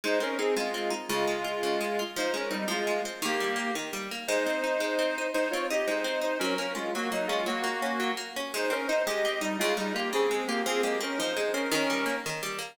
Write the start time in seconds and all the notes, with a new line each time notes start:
0.04 G#3 D#4 C5
0.20 C4 C#4 A#4
0.38 C4 D#4 G#4
0.56 G#3 F4
0.74 C4
0.90 D#4
1.09 C#3 G#3 F4
1.27 G#3
1.44 F4
1.63 C#3
1.81 G#3
1.99 F4
2.16 F3 D#4 C5
2.34 G#3 C#4 A#4
2.51 G3 C4 D#4
2.68 F3 G#3 F4
2.87 G#3
3.05 C4
3.22 D#3 A#3 G4
3.40 G3
3.56 A#3
3.75 D#3
3.93 G3
4.11 A#3
4.28 G#3 D#4 C5
4.46 C4
4.64 D#4
4.80 G#3
4.99 C4
5.18 D#4
5.34 G#3 D#4 C5
5.51 C4 F4 C#5
5.70 D#4 G4 D#5
5.87 G#3 D#4 C5
6.04 C4
6.21 D#4 C5
6.39 F#3 C#4 A#4
6.58 A#3 C#4 A#4
6.75 G#3 C#4 F4
6.95 F#3 A#3 F#4
7.12 F#3 A#3 D#4
7.27 G#3 C#4 F4
7.46 F#3 A#3 F#4
7.64 A#3
7.82 C#4
8.00 F#3
8.17 A#3
8.36 C#4
8.54 G#3 D#4 C5
8.70 C4 C#4 A#4
8.88 D#4 C5
9.06 G#3 G4 D#5
9.25 C4
9.41 G3 D#4
9.59 C#3 G#3 F4
9.77 G3 G#3 D#4
9.94 A#3 F4 G4
10.13 C#3 C4 G#4
10.31 G#3
10.47 A#3 F4 G4
10.66 F3 C4 G#4
10.83 G#3 A#3 G4
11.01 C4 C#4 A#4
11.18 F3 D#4 C5
11.37 G#3
11.53 C4 C#4 A#4
11.71 D#3 C#4 A#4
11.90 G3
12.06 A#3
12.26 D#3
12.43 G3
12.58 A#3